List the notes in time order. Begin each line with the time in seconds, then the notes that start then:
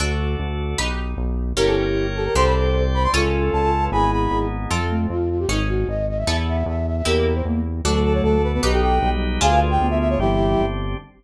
0.00 D2 D4 F#4 A4
0.39 D2
0.78 B1 D#4 G4 B4
1.17 B1
1.56 G1 A#3 C#4 E4 G4 A#4 C#5 G5
1.67 A4
2.16 G4 A4
2.25 A#4
2.35 C2 C4 D4 G4 A4 C5 D5 G5 C6
2.45 B5
2.94 C5 B5
3.04 C6
3.13 C#2 C#4 F4 A4 C#6
3.53 C#2 A5
3.83 B4
3.92 G#1 B3 D#4 E4 G#4 G#5 B5
4.12 B5
4.31 G#1
4.71 F2 F3 C4 F4 A4
4.90 A3
5.10 F2 F4
5.30 F4
5.39 G4
5.49 G#1 C#4 D#4 G#4
5.69 F#4
5.88 G#1 D#5
6.09 D#5
6.18 E5
6.27 E2 B3 E4 A4 E5
6.48 E5
6.66 E2 E5
6.86 E5
6.96 E5
7.05 E2 A#3 E4 G4 A#4
7.34 C5
7.45 E2 A#3
7.84 D2 F#3 A3 D4 F#4 A4
7.94 A4
8.04 A4
8.14 C#5
8.23 D2 A4
8.43 B4
8.53 B3 B4
8.63 B1 D#4 G4 B4
8.72 G4 A4
8.82 G5
9.02 B1 G3
9.13 G3
9.41 D2 D4 F4 G#4 F5 G#5
9.51 B4
9.71 G5
9.79 D2 B3
9.90 B3 E5
10.00 E5
10.10 C#5
10.19 G1 E3 G3 C4 D4 E4 G4
10.60 G1